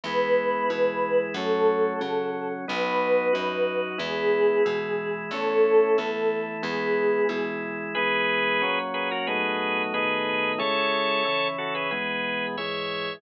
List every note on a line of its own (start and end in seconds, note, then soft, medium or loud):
0.03 0.63 E2 medium
0.03 0.69 G#3 medium
0.03 0.71 B3 medium
0.03 0.69 E4 medium
0.03 1.19 B4 loud
0.70 1.29 B2 medium
0.70 1.35 E3 medium
0.70 1.35 G#3 medium
0.70 1.35 E4 medium
1.34 1.94 F#2 loud
1.34 2.00 F#3 medium
1.34 2.01 A3 medium
1.34 2.00 C#4 medium
1.34 2.45 A4 medium
2.00 2.65 C#3 medium
2.00 2.60 C#3 medium
2.00 2.65 F#3 medium
2.00 2.65 C#4 medium
2.68 3.29 B1 loud
2.68 3.33 F#3 medium
2.68 3.33 B3 medium
2.68 3.33 D#4 medium
2.68 3.79 B4 medium
3.33 3.94 F#2 medium
3.33 3.98 F#3 medium
3.33 3.98 D#4 medium
3.33 3.98 F#4 medium
3.98 4.59 E2 loud
3.98 4.63 G#3 medium
3.98 4.63 B3 medium
3.98 4.63 E4 medium
3.98 5.15 G#4 loud
4.65 5.25 B2 medium
4.65 5.30 E3 medium
4.65 5.30 G#3 medium
4.65 5.30 E4 medium
5.31 5.90 E2 medium
5.31 5.97 A3 medium
5.31 5.98 C#4 medium
5.31 5.97 E4 medium
5.31 6.42 A4 medium
5.98 6.57 E2 medium
5.98 6.63 E3 medium
5.98 6.63 A3 medium
5.98 6.62 E4 medium
6.62 7.22 E2 loud
6.62 7.28 G#3 medium
6.62 7.28 B3 medium
6.62 7.28 E4 medium
6.62 7.48 G#4 medium
7.29 7.88 B2 medium
7.29 7.94 E3 medium
7.29 7.94 G#3 medium
7.29 7.94 E4 medium
7.95 8.62 E3 medium
7.95 8.62 G#3 medium
7.95 8.62 B3 medium
7.95 8.79 G#4 loud
7.95 8.79 B4 loud
8.62 9.27 A#2 medium
8.62 9.27 F#3 medium
8.62 9.27 C#4 medium
8.94 9.09 G#4 medium
8.94 9.09 B4 loud
9.11 9.27 F#4 medium
9.11 9.27 A#4 loud
9.27 9.93 B1 medium
9.27 9.93 A2 medium
9.27 9.93 F#3 medium
9.27 9.93 D#4 medium
9.27 9.83 G#4 medium
9.27 9.83 B4 loud
9.94 10.59 B1 medium
9.94 10.59 A2 medium
9.94 10.59 D#3 medium
9.94 10.59 D#4 medium
9.94 10.52 G#4 loud
9.94 10.52 B4 loud
10.58 11.23 C#3 medium
10.58 11.23 G#3 medium
10.58 11.23 E4 medium
10.58 11.48 A4 loud
10.58 11.48 C#5 loud
11.25 11.90 C#3 medium
11.25 11.90 E3 medium
11.25 11.90 E4 medium
11.58 11.74 F#4 medium
11.58 11.74 A4 medium
11.75 11.90 G#4 medium
11.75 11.90 B4 medium
11.91 12.56 E2 medium
11.91 12.56 B2 medium
11.91 12.56 G#3 medium
11.91 12.46 G#4 medium
11.91 12.46 B4 loud
12.57 13.21 E2 medium
12.57 13.21 G#2 medium
12.57 13.21 G#3 medium
12.57 13.14 C#5 medium
12.57 13.14 E5 loud